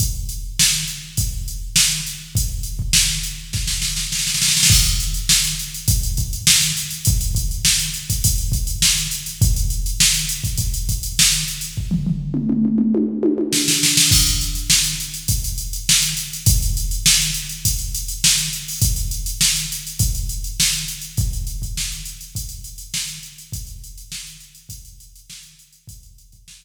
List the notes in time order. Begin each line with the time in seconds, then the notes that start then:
0.00 kick, closed hi-hat
0.29 closed hi-hat
0.59 snare
0.88 closed hi-hat
1.17 kick, closed hi-hat
1.48 closed hi-hat
1.76 snare
2.06 closed hi-hat
2.35 kick, closed hi-hat
2.63 closed hi-hat
2.79 kick
2.93 snare
3.23 closed hi-hat
3.53 kick, snare
3.67 snare
3.82 snare
3.96 snare
4.12 snare
4.19 snare
4.27 snare
4.34 snare
4.42 snare
4.48 snare
4.57 snare
4.63 snare
4.70 kick, crash
4.85 closed hi-hat
5.00 closed hi-hat
5.14 closed hi-hat
5.29 snare
5.44 closed hi-hat
5.59 closed hi-hat
5.74 closed hi-hat
5.88 kick, closed hi-hat
6.03 closed hi-hat
6.17 kick, closed hi-hat
6.33 closed hi-hat
6.47 snare
6.61 closed hi-hat
6.77 closed hi-hat
6.91 closed hi-hat
7.05 kick, closed hi-hat
7.21 closed hi-hat
7.35 kick, closed hi-hat
7.51 closed hi-hat
7.65 snare
7.79 closed hi-hat
7.94 closed hi-hat
8.10 kick, closed hi-hat
8.24 kick, closed hi-hat
8.38 closed hi-hat
8.52 kick, closed hi-hat
8.67 closed hi-hat
8.82 snare
8.98 closed hi-hat
9.11 closed hi-hat
9.26 closed hi-hat
9.42 kick, closed hi-hat
9.56 closed hi-hat
9.70 closed hi-hat
9.86 closed hi-hat
10.00 snare
10.14 closed hi-hat
10.29 closed hi-hat
10.44 kick, closed hi-hat
10.57 kick, closed hi-hat
10.74 closed hi-hat
10.89 kick, closed hi-hat
11.03 closed hi-hat
11.19 snare
11.32 closed hi-hat
11.48 closed hi-hat
11.61 closed hi-hat
11.77 kick
11.91 floor tom
12.06 floor tom
12.34 mid tom
12.50 mid tom
12.65 mid tom
12.78 mid tom
12.95 high tom
13.23 high tom
13.38 high tom
13.53 snare
13.68 snare
13.83 snare
13.97 snare
14.11 kick, crash
14.27 closed hi-hat
14.41 closed hi-hat
14.55 closed hi-hat
14.70 snare
14.84 closed hi-hat
15.00 closed hi-hat
15.14 closed hi-hat
15.28 kick, closed hi-hat
15.44 closed hi-hat
15.58 closed hi-hat
15.73 closed hi-hat
15.89 snare
16.02 closed hi-hat
16.17 closed hi-hat
16.33 closed hi-hat
16.46 kick, closed hi-hat
16.62 closed hi-hat
16.77 closed hi-hat
16.91 closed hi-hat
17.06 snare
17.21 closed hi-hat
17.34 closed hi-hat
17.49 closed hi-hat
17.65 kick, closed hi-hat
17.79 closed hi-hat
17.95 closed hi-hat
18.08 closed hi-hat
18.24 snare
18.38 closed hi-hat
18.53 closed hi-hat
18.68 open hi-hat
18.82 kick, closed hi-hat
18.96 closed hi-hat
19.11 closed hi-hat
19.26 closed hi-hat
19.41 snare
19.56 closed hi-hat
19.72 closed hi-hat
19.87 closed hi-hat
19.99 kick, closed hi-hat
20.15 closed hi-hat
20.29 closed hi-hat
20.44 closed hi-hat
20.60 snare
20.73 closed hi-hat
20.88 closed hi-hat
21.01 closed hi-hat
21.17 kick, closed hi-hat
21.33 closed hi-hat
21.47 closed hi-hat
21.62 kick, closed hi-hat
21.77 snare
21.92 closed hi-hat
22.05 closed hi-hat
22.21 closed hi-hat
22.35 kick, closed hi-hat
22.49 closed hi-hat
22.64 closed hi-hat
22.78 closed hi-hat
22.94 snare
23.07 closed hi-hat
23.23 closed hi-hat
23.38 closed hi-hat
23.52 kick, closed hi-hat
23.67 closed hi-hat
23.84 closed hi-hat
23.98 closed hi-hat
24.12 snare
24.27 closed hi-hat
24.40 closed hi-hat
24.55 closed hi-hat
24.69 kick, closed hi-hat
24.85 closed hi-hat
25.00 closed hi-hat
25.16 closed hi-hat
25.30 snare
25.43 closed hi-hat
25.59 closed hi-hat
25.73 closed hi-hat
25.87 kick, closed hi-hat
26.03 closed hi-hat
26.18 closed hi-hat
26.32 kick, closed hi-hat
26.48 snare
26.62 closed hi-hat